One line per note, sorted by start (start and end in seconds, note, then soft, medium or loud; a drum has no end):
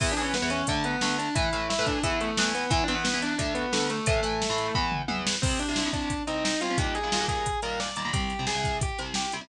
0.00 0.14 E2 loud
0.00 0.14 E3 loud
0.00 0.14 B3 loud
0.00 0.11 E4 medium
0.00 0.11 E5 medium
0.00 kick loud
0.00 crash loud
0.12 0.22 D4 medium
0.12 0.22 D5 medium
0.17 0.37 E2 medium
0.17 0.37 E3 medium
0.17 0.37 B3 medium
0.17 closed hi-hat medium
0.21 0.32 C#4 medium
0.21 0.32 C#5 medium
0.34 0.48 B3 medium
0.34 0.48 B4 medium
0.34 snare loud
0.42 0.62 E2 medium
0.42 0.62 E3 medium
0.42 0.62 B3 medium
0.50 0.66 C#4 medium
0.50 0.66 C#5 medium
0.50 closed hi-hat medium
0.67 0.96 D2 loud
0.67 0.96 D3 loud
0.67 0.96 A3 loud
0.67 0.83 D4 medium
0.67 0.83 D5 medium
0.67 kick medium
0.67 closed hi-hat loud
0.84 1.15 B3 medium
0.84 1.15 B4 medium
0.84 closed hi-hat medium
1.01 1.29 D2 medium
1.01 1.29 D3 medium
1.01 1.29 A3 medium
1.01 snare loud
1.19 1.34 D4 medium
1.19 1.34 D5 medium
1.19 closed hi-hat medium
1.35 1.49 A2 loud
1.35 1.49 E3 loud
1.35 1.49 A3 medium
1.35 1.66 E4 medium
1.35 1.66 E5 medium
1.35 kick loud
1.35 closed hi-hat loud
1.53 1.73 A2 medium
1.53 1.73 E3 medium
1.53 1.73 A3 medium
1.53 closed hi-hat medium
1.70 1.86 E4 medium
1.70 1.86 E5 medium
1.70 snare loud
1.79 1.99 A2 medium
1.79 1.99 E3 loud
1.79 1.99 A3 medium
1.86 2.02 D4 soft
1.86 2.02 D5 medium
1.86 kick medium
1.86 closed hi-hat medium
2.03 2.31 E2 loud
2.03 2.31 E3 medium
2.03 2.31 B3 loud
2.03 2.17 E4 medium
2.03 2.17 E5 medium
2.03 kick medium
2.03 closed hi-hat loud
2.21 2.51 A3 medium
2.21 2.51 A4 medium
2.21 closed hi-hat medium
2.37 2.65 E2 medium
2.37 2.65 E3 medium
2.37 2.65 B3 medium
2.37 snare loud
2.55 2.71 B3 medium
2.55 2.71 B4 medium
2.55 closed hi-hat medium
2.70 2.84 E2 loud
2.70 2.84 E3 loud
2.70 2.84 B3 loud
2.70 2.82 E4 medium
2.70 2.82 E5 medium
2.70 kick loud
2.70 closed hi-hat loud
2.84 2.94 D4 medium
2.84 2.94 D5 medium
2.88 3.08 E2 medium
2.88 3.08 E3 medium
2.88 3.08 B3 medium
2.88 closed hi-hat medium
2.95 3.03 B3 medium
2.95 3.03 B4 medium
3.04 3.18 B3 medium
3.04 3.18 B4 medium
3.04 snare loud
3.13 3.34 E2 medium
3.13 3.34 E3 medium
3.13 3.34 B3 medium
3.22 3.38 D4 medium
3.22 3.38 D5 medium
3.22 closed hi-hat medium
3.38 3.66 D2 loud
3.38 3.66 D3 medium
3.38 3.66 A3 medium
3.38 3.52 D4 medium
3.38 3.52 D5 medium
3.38 kick medium
3.38 closed hi-hat loud
3.55 3.87 B3 medium
3.55 3.87 B4 medium
3.55 closed hi-hat medium
3.72 4.00 D2 medium
3.72 4.00 D3 medium
3.72 4.00 A3 medium
3.72 snare loud
3.90 4.06 A3 medium
3.90 4.06 A4 medium
3.90 closed hi-hat medium
4.06 4.20 A2 loud
4.06 4.20 E3 medium
4.06 4.20 A3 loud
4.06 4.72 A3 medium
4.06 4.72 A4 medium
4.06 kick loud
4.06 closed hi-hat loud
4.23 4.43 A2 medium
4.23 4.43 E3 medium
4.23 4.43 A3 medium
4.23 closed hi-hat medium
4.42 snare loud
4.50 4.70 A2 medium
4.50 4.70 E3 medium
4.50 4.70 A3 medium
4.58 closed hi-hat medium
4.75 5.02 E2 loud
4.75 5.02 E3 loud
4.75 5.02 B3 loud
4.75 kick loud
4.92 mid tom loud
5.08 5.35 E2 medium
5.08 5.35 E3 medium
5.08 5.35 B3 medium
5.08 high tom loud
5.27 snare loud
5.42 5.64 C2 medium
5.42 5.64 C3 medium
5.42 5.64 G3 medium
5.42 5.58 C4 medium
5.42 5.58 C5 medium
5.42 kick loud
5.42 crash loud
5.59 5.88 D4 medium
5.59 5.88 D5 medium
5.59 closed hi-hat medium
5.68 5.75 C2 medium
5.68 5.75 C3 medium
5.68 5.75 G3 medium
5.76 5.84 C2 medium
5.76 5.84 C3 medium
5.76 5.84 G3 medium
5.76 snare loud
5.85 6.12 C2 medium
5.85 6.12 C3 medium
5.85 6.12 G3 medium
5.93 6.22 D4 medium
5.93 6.22 D5 medium
5.93 kick medium
5.93 closed hi-hat medium
6.10 kick medium
6.10 closed hi-hat loud
6.27 6.54 C2 medium
6.27 6.54 C3 medium
6.27 6.54 G3 medium
6.27 6.42 D#4 medium
6.27 6.42 D#5 medium
6.27 closed hi-hat medium
6.44 6.61 D#4 medium
6.44 6.61 D#5 medium
6.44 snare loud
6.61 6.69 C2 medium
6.61 6.69 C3 medium
6.61 6.69 G3 medium
6.61 6.76 F4 medium
6.61 6.76 F5 medium
6.61 closed hi-hat medium
6.70 6.77 C2 medium
6.70 6.77 C3 medium
6.70 6.77 G3 medium
6.78 6.98 D#2 medium
6.78 6.98 A#2 medium
6.78 6.98 G3 medium
6.78 6.94 G4 medium
6.78 6.94 G5 medium
6.78 kick loud
6.78 closed hi-hat loud
6.95 7.25 G#4 medium
6.95 7.25 G#5 medium
6.95 closed hi-hat medium
7.03 7.10 D#2 medium
7.03 7.10 A#2 medium
7.03 7.10 G3 medium
7.12 7.19 D#2 medium
7.12 7.19 A#2 medium
7.12 7.19 G3 medium
7.12 snare loud
7.20 7.47 D#2 medium
7.20 7.47 A#2 medium
7.20 7.47 G3 medium
7.28 7.58 G#4 medium
7.28 7.58 G#5 medium
7.28 kick medium
7.28 closed hi-hat medium
7.46 kick medium
7.46 closed hi-hat loud
7.62 7.90 D#2 medium
7.62 7.90 A#2 medium
7.62 7.90 G3 medium
7.62 7.79 A#4 medium
7.62 7.79 A#5 medium
7.62 closed hi-hat medium
7.80 7.94 D5 medium
7.80 7.94 D6 medium
7.80 snare loud
7.96 8.03 D#2 medium
7.96 8.03 A#2 medium
7.96 8.03 G3 medium
7.96 8.11 D5 medium
7.96 8.11 D6 medium
7.96 closed hi-hat medium
8.05 8.11 D#2 medium
8.05 8.11 A#2 medium
8.05 8.11 G3 medium
8.13 8.33 C2 medium
8.13 8.33 C3 medium
8.13 8.33 G3 medium
8.13 8.43 G4 medium
8.13 8.43 G5 medium
8.13 kick loud
8.13 closed hi-hat loud
8.30 closed hi-hat medium
8.39 8.46 C2 medium
8.39 8.46 C3 medium
8.39 8.46 G3 medium
8.47 8.54 C2 medium
8.47 8.54 C3 medium
8.47 8.54 G3 medium
8.47 8.76 G#4 medium
8.47 8.76 G#5 medium
8.47 snare loud
8.55 8.82 C2 medium
8.55 8.82 C3 medium
8.55 8.82 G3 medium
8.64 kick medium
8.64 closed hi-hat medium
8.81 8.98 G4 soft
8.81 8.98 G5 medium
8.81 kick loud
8.81 closed hi-hat loud
8.99 9.26 C2 medium
8.99 9.26 C3 medium
8.99 9.26 G3 medium
8.99 closed hi-hat medium
9.14 9.31 G4 medium
9.14 9.31 G5 medium
9.14 snare loud
9.32 9.40 C2 medium
9.32 9.40 C3 medium
9.32 9.40 G3 medium
9.32 closed hi-hat medium
9.41 9.48 C2 medium
9.41 9.48 C3 medium
9.41 9.48 G3 medium